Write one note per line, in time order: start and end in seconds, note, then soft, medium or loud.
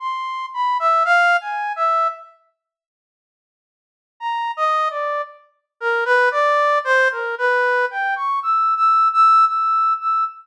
0.00 0.46 C6 medium
0.54 0.77 B5 medium
0.80 1.03 E5 medium
1.05 1.37 F5 loud
1.41 1.73 G#5 soft
1.76 2.08 E5 medium
4.20 4.52 A#5 medium
4.57 4.88 D#5 medium
4.90 5.22 D5 soft
5.80 6.04 A#4 medium
6.05 6.29 B4 loud
6.31 6.79 D5 loud
6.84 7.08 C5 loud
7.11 7.35 A#4 medium
7.38 7.86 B4 medium
7.91 8.14 G5 medium
8.16 8.39 C#6 medium
8.43 8.74 E6 medium
8.77 9.08 E6 medium
9.13 9.45 E6 loud
9.46 9.93 E6 medium
10.01 10.24 E6 medium